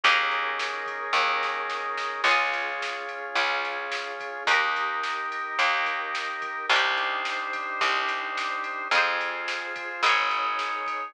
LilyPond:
<<
  \new Staff \with { instrumentName = "Drawbar Organ" } { \time 4/4 \key aes \major \tempo 4 = 108 <des' ees' aes' bes'>1 | <des' f' aes'>1 | <ees' g' bes'>1 | <d' ees' g' c''>1 |
<f' aes' c''>2 <ees' aes' des''>2 | }
  \new Staff \with { instrumentName = "Pizzicato Strings" } { \time 4/4 \key aes \major <des' ees' aes' bes'>1 | <des' f' aes'>1 | <ees' g' bes'>1 | <d' ees' g' c''>1 |
<f' aes' c''>2 <ees' aes' des''>2 | }
  \new Staff \with { instrumentName = "Electric Bass (finger)" } { \clef bass \time 4/4 \key aes \major ees,2 ees,2 | des,2 des,2 | ees,2 ees,2 | c,2 c,2 |
f,2 aes,,2 | }
  \new Staff \with { instrumentName = "Pad 5 (bowed)" } { \time 4/4 \key aes \major <des' ees' aes' bes'>1 | <des' f' aes'>1 | <ees' g' bes'>1 | <d' ees' g' c''>1 |
<f' aes' c''>2 <ees' aes' des''>2 | }
  \new DrumStaff \with { instrumentName = "Drums" } \drummode { \time 4/4 <bd cymr>8 cymr8 sn8 <bd cymr>8 <bd sn>8 sn8 sn8 sn8 | <cymc bd>8 cymr8 sn8 cymr8 <bd cymr>8 cymr8 sn8 <bd cymr>8 | <bd cymr>8 cymr8 sn8 cymr8 <bd cymr>8 <bd cymr>8 sn8 <bd cymr>8 | <bd cymr>8 cymr8 sn8 <bd cymr>8 <bd cymr>8 cymr8 sn8 cymr8 |
<bd cymr>8 cymr8 sn8 <bd cymr>8 <bd cymr>8 cymr8 sn8 <bd cymr>8 | }
>>